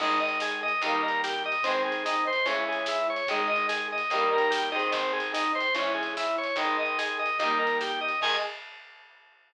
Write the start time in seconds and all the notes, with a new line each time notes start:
0.00 G#1 D#3 G#3 D#4, kick, crash
0.20 D#5
0.28 closed hi-hat
0.40 G#4, snare
0.63 D#5
0.68 closed hi-hat
0.82 D#2 D#3 G3 D#4, kick, closed hi-hat
0.86 A#3
1.03 A#4
1.08 closed hi-hat
1.24 G4, snare
1.45 D#5
1.52 closed hi-hat
1.63 G#1 D#3 G#3 C4, kick, closed hi-hat
1.68 C4
1.85 G#4
1.92 closed hi-hat
2.05 D#4, snare
2.27 C5
2.33 closed hi-hat
2.46 C#2 E3 G#3 C#4, kick, closed hi-hat
2.50 C#4
2.68 G#4
2.73 closed hi-hat
2.86 E4, snare
3.10 C#5
3.16 closed hi-hat
3.27 G#1 D#3 G#3 D#4, kick, closed hi-hat
3.48 D#5
3.56 closed hi-hat
3.69 G#4, snare
3.92 D#5
3.98 closed hi-hat
4.10 D#2 D#3 G3 D#4, kick, closed hi-hat
4.15 A#3
4.33 A#4
4.38 closed hi-hat
4.50 G4, snare
4.72 D#3 G#3 D#5
4.76 C4, closed hi-hat
4.92 G#1 C4, kick, closed hi-hat
5.13 G#4
5.20 closed hi-hat
5.33 D#4, snare
5.55 C5
5.60 closed hi-hat
5.74 G#1 E3 G#3 C#4, kick, closed hi-hat
5.79 C#4
5.94 G#4
6.03 closed hi-hat
6.17 E4, snare
6.38 C#5
6.43 closed hi-hat
6.56 G#1 D#3 G#3 D#4, kick, closed hi-hat
6.79 D#5
6.86 closed hi-hat
6.98 G#4, snare
7.19 D#5
7.26 closed hi-hat
7.39 D#2 D#3 G3 D#4, kick, closed hi-hat
7.44 A#3
7.59 A#4
7.67 closed hi-hat
7.81 G4, snare
8.01 D#5
8.08 closed hi-hat
8.21 G#2 D#3 G#3 G#5, kick, crash